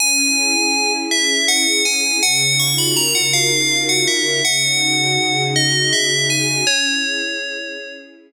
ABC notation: X:1
M:12/8
L:1/8
Q:3/8=108
K:C#dor
V:1 name="Tubular Bells"
g6 e2 f2 g2 | f2 c' b a f ^e3 f =e2 | f6 d2 e2 g2 | c7 z5 |]
V:2 name="String Ensemble 1"
C E G C E G C E G C E G | C, D ^E F A C, D E F A C, D | C, D F G C, D F G C, D F G | C E G C E G C E G z3 |]